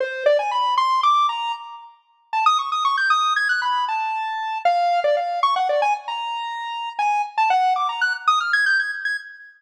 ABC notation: X:1
M:9/8
L:1/16
Q:3/8=77
K:none
V:1 name="Lead 1 (square)"
c2 d ^g b2 c'2 d'2 ^a2 z6 | a ^d' ^c' d' c' g' d'2 ^g' ^f' b2 a6 | f3 d f2 ^c' ^f d ^g z ^a7 | ^g2 z a ^f2 d' ^a ^f' z ^d' =f' ^g' =g' ^g' z g' z |]